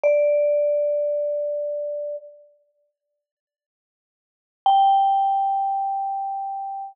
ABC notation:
X:1
M:3/4
L:1/8
Q:1/4=78
K:Bb
V:1 name="Vibraphone"
d6 | z6 | g6 |]